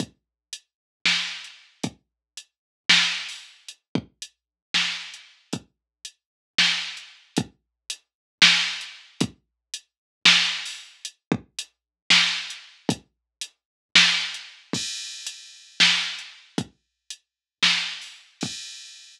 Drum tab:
CC |--------------|--------------|--------------|--------------|
HH |x---x------x--|x---x------o--|x---x------x--|x---x------x--|
SD |--------o-----|--------o-----|--------o-----|--------o-----|
BD |o-------------|o-------------|--o-----------|o-------------|

CC |--------------|--------------|--------------|--------------|
HH |x---x------x--|x---x------o--|x---x------x--|x---x------x--|
SD |--------o-----|--------o-----|--------o-----|--------o-----|
BD |o-------------|o-------------|--o-----------|o-------------|

CC |x-------------|--------------|x-------------|
HH |----x------x--|x---x------o--|--------------|
SD |--------o-----|--------o-----|--------------|
BD |o-------------|o-------------|o-------------|